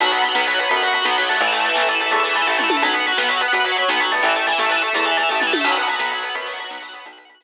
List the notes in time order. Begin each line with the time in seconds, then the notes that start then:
0.00 B1 F#3 B3, kick, closed hi-hat
0.06 F#4
0.11 B3 B4, closed hi-hat
0.18 B3 F#5
0.24 F#3, closed hi-hat
0.28 F#4
0.35 B1 B3 B4, snare
0.40 F#5
0.47 F#3 B3, closed hi-hat
0.54 F#4
0.59 B3 B4 F#5, closed hi-hat
0.69 F#2 B3, kick, closed hi-hat
0.77 F#4
0.82 F#3 B4, closed hi-hat
0.87 F#5
0.93 F#3 B3, closed hi-hat
1.01 B1 F#4 B4, snare
1.06 B3
1.10 F#5
1.18 F#3 B3, closed hi-hat
1.23 F#4
1.29 A3 B3, open hi-hat
1.40 A1 E3, kick, closed hi-hat
1.47 E4 A4
1.52 A3, closed hi-hat
1.60 A3 E5
1.65 E3 E4, closed hi-hat
1.75 A1 A3 A4, snare
1.82 E5
1.88 E3 A3, closed hi-hat
1.95 E4
2.00 A3 A4, closed hi-hat
2.06 E5
2.10 E2 A3, kick, closed hi-hat
2.19 E4
2.23 E3 A4, closed hi-hat
2.29 E5
2.35 E3 A3, closed hi-hat
2.42 E4
2.46 A1 A3 A4, kick, floor tom
2.51 E5
2.58 E3 A3, mid tom
2.64 E4
2.69 A3 A4, high tom
2.76 E5
2.82 B1 F#3 B3, kick, closed hi-hat
2.89 F#4
2.93 B3 B4, closed hi-hat
3.00 F#5
3.06 F#3 B3, closed hi-hat
3.12 F#4
3.17 B1 B3 B4, snare
3.23 F#5
3.28 F#3 B3, closed hi-hat
3.37 F#4 B4, closed hi-hat
3.42 B3
3.48 F#5
3.52 F#2 B3, kick, closed hi-hat
3.60 F#4
3.64 F#3 B4, closed hi-hat
3.72 F#5
3.76 F#3 B3, closed hi-hat
3.82 F#4
3.88 B1 B3 B4, snare
3.94 F#5
4.00 F#3 B3, closed hi-hat
4.04 F#4
4.11 A3 B3, open hi-hat
4.23 A1 E3, kick, closed hi-hat
4.29 E4
4.34 A3 A4, closed hi-hat
4.40 E5
4.46 E3 A3, closed hi-hat
4.52 E4
4.58 A1 A3 A4, snare
4.66 E3 E5
4.70 A3, closed hi-hat
4.76 E4
4.82 A3 A4, closed hi-hat
4.87 E5
4.93 E2 A3, kick, closed hi-hat
4.99 E4
5.05 E3 A4, closed hi-hat
5.11 E5
5.17 E3 A3, closed hi-hat
5.23 E4
5.29 A1 A3 A4, kick, floor tom
5.35 E5
5.40 E3 A3, mid tom
5.47 E4
5.53 A3 A4, high tom
5.61 B1 E5
5.65 F#3 B3, kick, crash
5.72 F#4, closed hi-hat
5.76 B3 B4
5.82 F#5
5.88 F#3 B3, closed hi-hat
5.96 B1 F#4 B4, snare
6.00 B3
6.05 F#5
6.11 F#3 B3, closed hi-hat
6.18 F#4
6.23 B3 B4, closed hi-hat
6.29 F#5
6.35 F#2 B3, kick, closed hi-hat
6.42 F#4
6.46 F#3 B4, closed hi-hat
6.53 F#5
6.59 F#3 B3, closed hi-hat
6.64 F#4
6.70 B1 B3 B4, snare
6.77 F#5
6.82 F#3 B3, closed hi-hat
6.88 F#4
6.93 B3 B4, closed hi-hat
7.00 F#5
7.05 B1 B3, kick, closed hi-hat
7.13 F#4
7.17 B4, closed hi-hat
7.25 F#5
7.29 B3, closed hi-hat
7.34 F#4
7.40 B1 B4, snare